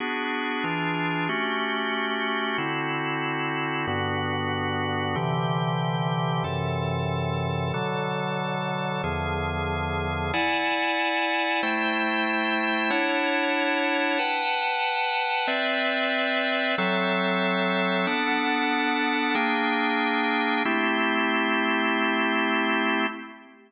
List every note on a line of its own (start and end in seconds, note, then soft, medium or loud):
0.00 0.64 B3 medium
0.00 0.63 D4 medium
0.00 0.64 F#4 medium
0.00 0.63 G#4 medium
0.64 1.28 E3 medium
0.64 1.28 D4 medium
0.64 1.28 F4 medium
0.64 1.28 G#4 medium
1.29 2.57 A3 medium
1.29 2.57 C#4 medium
1.29 2.57 F#4 medium
1.29 2.57 G4 medium
2.58 3.86 D3 medium
2.58 3.86 C4 medium
2.58 3.86 E4 medium
2.58 3.86 F#4 medium
3.87 5.15 G2 medium
3.87 5.15 D3 medium
3.87 5.15 B3 medium
3.87 5.15 F#4 medium
5.15 6.43 C3 medium
5.15 6.43 D3 medium
5.15 6.43 E3 medium
5.15 6.43 G4 medium
6.44 7.72 F#2 medium
6.44 7.72 C3 medium
6.44 7.72 E3 medium
6.44 7.72 A4 medium
7.74 9.02 B2 medium
7.74 9.02 D3 medium
7.74 9.02 F#3 medium
7.74 9.02 A4 medium
9.04 10.32 E2 medium
9.04 10.32 D3 medium
9.04 10.32 F3 medium
9.04 10.32 G#4 medium
10.33 11.62 E4 loud
10.33 11.62 D5 loud
10.33 11.62 F#5 loud
10.33 11.62 G#5 loud
11.63 12.91 A3 medium
11.63 12.90 E4 loud
11.63 12.91 C5 loud
11.63 12.91 G5 medium
12.90 14.18 D4 medium
12.90 14.18 E4 loud
12.90 14.18 C#5 loud
12.90 14.18 F#5 medium
14.19 15.47 B4 loud
14.19 15.47 F#5 medium
14.19 15.47 G5 medium
14.19 15.47 A5 loud
15.47 16.76 C4 medium
15.47 16.76 B4 medium
15.47 16.76 D5 loud
15.47 16.76 E5 loud
16.78 18.06 F#3 loud
16.78 18.06 C4 medium
16.78 18.06 A4 loud
16.78 18.06 E5 medium
18.07 19.35 B3 medium
18.07 19.34 D4 loud
18.07 19.35 A4 loud
18.07 19.35 F#5 loud
19.35 20.63 A#3 loud
19.35 20.63 D4 loud
19.35 20.63 G#4 loud
19.35 20.63 G5 loud
20.65 23.06 A3 loud
20.65 23.06 C4 loud
20.65 23.06 E4 loud
20.65 23.06 G4 loud